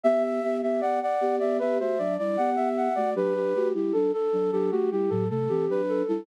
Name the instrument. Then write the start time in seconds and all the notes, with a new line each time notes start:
flute
0.04 B3 G4 E5
0.24 E5
0.43 B3 G4 E5
0.62 B3 G4 E5
0.81 B3 G4 D5 F#5
1.01 D5 F#5
1.21 B3 G4
1.39 B3 G4 D5 E5
1.59 B3 G4 B4 E5
1.79 A3 F#4 C5 E5
1.98 F#3 D4 D5
2.18 G3 E4 D5
2.37 B3 G4 F#5
2.56 B3 G4 E5
2.77 F#5
2.95 A3 F#4 D5
3.15 F#3 D4 G4 B4
3.35 G4
3.54 A3 F#4 G4
3.74 G3 E4 G4
3.93 F#3 D4 A4
4.13 A4
4.33 F#3 D4
4.52 F#3 D4 G4 A4
4.71 A3 F#4 G4
4.91 G3 E4 G4
5.10 A2 F#3 A4
5.30 C3 A3 A4
5.49 E3 C4 G4
5.69 F#3 D4 B4
5.89 A4
6.08 G3 E4 A4